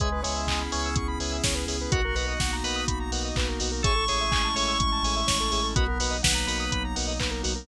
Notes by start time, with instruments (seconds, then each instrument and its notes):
0.00 synth bass 2 C#2, drawbar organ G#3 B4 C#5 E5 G#5, pad 5 (bowed) B3 C#4 E4 G#4, lead 1 (square) G#4, kick, closed hi-hat
0.12 lead 1 (square) B4
0.23 synth bass 2 C#2, drawbar organ G#3 B4 C#5 E5 G#5, lead 1 (square) C#5, open hi-hat
0.36 lead 1 (square) E5
0.47 synth bass 2 C#2, lead 1 (square) G#5, kick, clap
0.60 lead 1 (square) B5
0.72 synth bass 2 C#2, drawbar organ C#4 B4 C#5 E5 G#5, lead 1 (square) C#6, open hi-hat
0.85 lead 1 (square) E6
0.96 synth bass 2 C#2, lead 1 (square) C#6, kick, closed hi-hat
1.08 lead 1 (square) B5
1.19 synth bass 2 C#2, drawbar organ B4 C#5 E5 G#5, lead 1 (square) G#5, open hi-hat
1.32 lead 1 (square) E5
1.44 synth bass 2 C#2, lead 1 (square) C#5, kick, snare
1.55 lead 1 (square) B4
1.66 synth bass 2 C#2, lead 1 (square) G#4, drawbar organ B4 C#5 E5 G#5, open hi-hat
1.81 lead 1 (square) B4
1.91 synth bass 2 B1, pad 5 (bowed) A#3 B3 D#4 F#4, lead 1 (square) F#4, drawbar organ F#4 A#4 B4 D#5 F#5, kick, closed hi-hat
2.05 lead 1 (square) A#4
2.15 synth bass 2 B1, drawbar organ F#4 A#4 B4 D#5 F#5, lead 1 (square) B4, open hi-hat
2.28 lead 1 (square) D#5
2.40 synth bass 2 B1, lead 1 (square) F#5, kick, snare
2.53 lead 1 (square) A#5
2.64 synth bass 2 B1, drawbar organ A#4 B4 D#5 F#5, lead 1 (square) B5, open hi-hat
2.76 lead 1 (square) D#6
2.88 synth bass 2 B1, lead 1 (square) B5, kick, closed hi-hat
3.00 lead 1 (square) A#5
3.11 synth bass 2 B1, drawbar organ A#4 B4 D#5 F#5, lead 1 (square) F#5, open hi-hat
3.25 lead 1 (square) D#5
3.36 synth bass 2 B1, lead 1 (square) B4, kick, clap
3.48 lead 1 (square) A#4
3.60 synth bass 2 B1, lead 1 (square) F#4, drawbar organ A#4 B4 D#5 F#5, open hi-hat
3.72 lead 1 (square) A#4
3.83 synth bass 2 A1, pad 5 (bowed) G#3 A3 C#4 E4, drawbar organ G#4 A4 C#5 E5, lead 1 (square) G#4 C#6, kick, closed hi-hat
3.96 lead 1 (square) A4
4.08 synth bass 2 A1, drawbar organ G#4 A4 C#5 E5, lead 1 (square) C#5, open hi-hat
4.21 lead 1 (square) E5
4.31 synth bass 2 A1, lead 1 (square) G#5, kick, clap
4.44 lead 1 (square) A5
4.55 synth bass 2 A1, drawbar organ G#4 A4 C#5 E5, lead 1 (square) C#6, open hi-hat
4.68 lead 1 (square) E6
4.79 synth bass 2 A1, lead 1 (square) C#6, kick, closed hi-hat
4.92 lead 1 (square) A5
5.03 synth bass 2 A1, drawbar organ G#4 A4 C#5 E5, lead 1 (square) G#5, open hi-hat
5.16 lead 1 (square) E5
5.27 synth bass 2 A1, lead 1 (square) C#5, kick, snare
5.40 lead 1 (square) A4
5.52 synth bass 2 A1, lead 1 (square) G#4, drawbar organ G#4 A4 C#5 E5, open hi-hat
5.63 lead 1 (square) A4
5.76 synth bass 2 B1, pad 5 (bowed) F#3 A#3 B3 D#4, drawbar organ B3 F#4 A#4 B4 D#5, lead 1 (square) F#4, kick, closed hi-hat
5.88 lead 1 (square) A#4
6.00 synth bass 2 B1, drawbar organ F#4 A#4 B4 D#5, lead 1 (square) B4, open hi-hat
6.11 lead 1 (square) D#5
6.23 synth bass 2 B1, drawbar organ B4, lead 1 (square) F#5, kick, snare
6.35 lead 1 (square) A#5
6.47 synth bass 2 B1, drawbar organ F#4 A#4 B4 D#5, lead 1 (square) B5, open hi-hat
6.60 lead 1 (square) D#6
6.72 synth bass 2 B1, lead 1 (square) B5, kick, closed hi-hat
6.84 lead 1 (square) A#5
6.95 synth bass 2 B1, drawbar organ F#4 A#4 B4 D#5, lead 1 (square) F#5, open hi-hat
7.08 lead 1 (square) D#5
7.20 synth bass 2 B1, lead 1 (square) B4, kick, clap
7.31 lead 1 (square) A#4
7.43 synth bass 2 B1, lead 1 (square) F#4, drawbar organ F#4 A#4 B4 D#5, open hi-hat
7.55 lead 1 (square) A#4